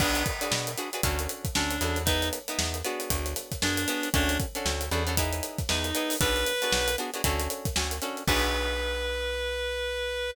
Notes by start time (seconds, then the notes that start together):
0.00 B1 D4 F#4 G#4 B4, kick, crash
0.15 closed hi-hat
0.26 kick, closed hi-hat
0.41 D4 F#4 G#4 B4, closed hi-hat
0.52 B2, snare
0.67 snare, closed hi-hat
0.77 D4 F#4 G#4 B4, closed hi-hat
0.93 D4 F#4 G#4 B4, closed hi-hat
1.03 D2 C#4 D4 F#4 A4, kick, closed hi-hat
1.19 closed hi-hat
1.29 closed hi-hat
1.45 kick, closed hi-hat
1.55 D2 C#4 D4 F#4 A4, snare
1.71 closed hi-hat
1.81 E2 C#4 D4 F#4 A4, closed hi-hat
1.96 closed hi-hat
2.05 B3 D#4 E4 G#4, kick, closed hi-hat
2.22 snare, closed hi-hat
2.33 closed hi-hat
2.48 B3 D#4 E4 G#4, closed hi-hat
2.59 E2, snare
2.74 closed hi-hat
2.84 B3 D4 F#4 G#4, closed hi-hat
3.00 closed hi-hat
3.10 D2, kick, closed hi-hat
3.26 closed hi-hat
3.36 snare, closed hi-hat
3.52 kick, snare, closed hi-hat
3.62 F#2 B3 D4 F#4 G#4, snare
3.77 closed hi-hat
3.88 B3 D4 F#4 G#4, snare, closed hi-hat
4.03 closed hi-hat
4.14 D2 C#4 D4 F#4 A4, kick, closed hi-hat
4.29 closed hi-hat
4.40 kick, closed hi-hat
4.55 C#4 D4 F#4 A4, closed hi-hat
4.65 D2, snare
4.81 closed hi-hat
4.91 E2 C#4 D4 F#4 A4, closed hi-hat
5.07 C#4 D4 F#4 A4, snare, closed hi-hat
5.17 B3 D#4 E4 G#4, kick, closed hi-hat
5.33 closed hi-hat
5.43 closed hi-hat
5.59 kick, snare, closed hi-hat
5.69 E2 B3 D#4 E4 G#4, snare
5.84 closed hi-hat
5.95 B3 D#4 E4 G#4, closed hi-hat
6.10 open hi-hat
6.20 B1 B3 D4 F#4 G#4 B4, kick, closed hi-hat
6.36 closed hi-hat
6.46 closed hi-hat
6.62 B3 D4 F#4 G#4, snare, closed hi-hat
6.72 B1, snare
6.88 closed hi-hat
6.98 B3 D4 F#4 G#4, closed hi-hat
7.14 B3 D4 F#4 G#4, closed hi-hat
7.24 D2 C#4 D4 F#4 A4, kick, closed hi-hat
7.40 closed hi-hat
7.50 closed hi-hat
7.65 kick, snare, closed hi-hat
7.76 D2 C#4 D4 F#4 A4, snare
7.91 closed hi-hat
8.02 C#4 D4 F#4 A4, closed hi-hat
8.17 closed hi-hat
8.27 B1 D4 F#4 G#4 B4, kick, crash